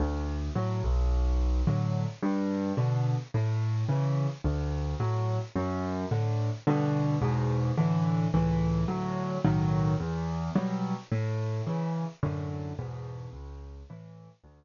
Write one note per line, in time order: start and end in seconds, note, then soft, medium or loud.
0.00 0.50 D2 loud
0.55 0.82 A2 medium
0.55 0.82 F#3 medium
0.84 1.62 B1 loud
1.67 2.06 A2 medium
1.67 2.06 D3 medium
1.67 2.06 F#3 medium
2.22 2.72 G2 loud
2.77 3.16 B2 medium
2.77 3.16 D3 medium
3.34 3.84 A2 loud
3.89 4.28 C#3 medium
3.89 4.28 E3 medium
4.44 4.94 D2 loud
5.00 5.39 A2 medium
5.00 5.39 F#3 medium
5.55 6.05 F#2 loud
6.11 6.50 A2 medium
6.11 6.50 D3 medium
6.67 7.17 G2 loud
6.67 7.17 B2 loud
6.67 7.17 D3 loud
7.22 7.72 E2 loud
7.22 7.72 G#2 loud
7.22 7.72 B2 loud
7.77 8.27 A2 loud
7.77 8.27 D3 loud
7.77 8.27 E3 loud
8.34 8.84 C#2 loud
8.34 8.84 A2 loud
8.34 8.84 E3 loud
8.88 9.38 D2 loud
8.88 9.38 A2 loud
8.88 9.38 F#3 loud
9.44 9.94 B1 loud
9.44 9.94 A2 loud
9.44 9.94 D#3 loud
9.44 9.94 F#3 loud
10.00 10.50 E2 loud
10.55 10.94 B2 medium
10.55 10.94 F#3 loud
10.55 10.94 G3 medium
11.12 11.62 A2 loud
11.67 12.05 C#3 medium
11.67 12.05 E3 medium
12.23 12.73 F#2 loud
12.23 12.73 A2 loud
12.23 12.73 D3 loud
12.79 13.29 E2 loud
12.79 13.29 G#2 loud
12.79 13.29 B2 loud
13.33 13.83 C#2 loud
13.90 14.29 A2 medium
13.90 14.29 E3 medium
14.44 14.64 D2 loud